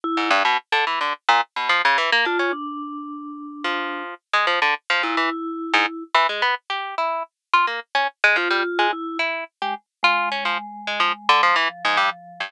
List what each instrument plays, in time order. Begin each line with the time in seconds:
0.04 vibraphone E4
0.17 orchestral harp G#2
0.30 orchestral harp G2
0.45 orchestral harp B2
0.72 orchestral harp D3
0.87 orchestral harp E3
1.01 orchestral harp D3
1.28 orchestral harp A#2
1.56 orchestral harp B2
1.69 orchestral harp F3
1.85 orchestral harp C#3
1.98 orchestral harp E3
2.12 orchestral harp A#3
2.25 orchestral harp D4, vibraphone F4
2.39 orchestral harp C#4
2.53 vibraphone D4
3.64 orchestral harp F3
4.33 orchestral harp G#3
4.47 orchestral harp F3
4.62 orchestral harp D3
4.90 orchestral harp F3
5.03 orchestral harp A#2, vibraphone E4
5.17 orchestral harp E3
5.73 orchestral harp G#2
6.14 orchestral harp E3
6.29 orchestral harp G#3
6.42 orchestral harp B3
6.70 orchestral harp G4
6.98 orchestral harp E4
7.53 orchestral harp F4
7.67 orchestral harp A#3
7.95 orchestral harp C#4
8.24 orchestral harp G#3
8.36 orchestral harp F3, vibraphone F4
8.50 orchestral harp G3
8.79 orchestral harp G#3
8.93 vibraphone E4
9.19 orchestral harp E4
9.62 vibraphone G#3, orchestral harp G4
10.03 vibraphone G#3, orchestral harp F4
10.32 orchestral harp C#4
10.45 orchestral harp F3
10.87 orchestral harp G#3
11.00 orchestral harp F3
11.29 orchestral harp D3
11.43 orchestral harp F3
11.56 orchestral harp E3
11.69 vibraphone F3
11.85 orchestral harp G#2
11.97 orchestral harp G2
12.40 orchestral harp G2